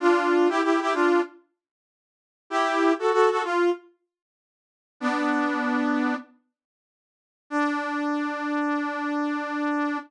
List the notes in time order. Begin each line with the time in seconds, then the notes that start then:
0.00 D4 F4
0.49 E4 G4
0.63 E4 G4
0.81 E4 G4
0.94 D4 F4
2.50 E4 G4
2.99 F#4 A4
3.12 F#4 A4
3.30 F#4 A4
3.44 F4
5.00 B3 D4
7.50 D4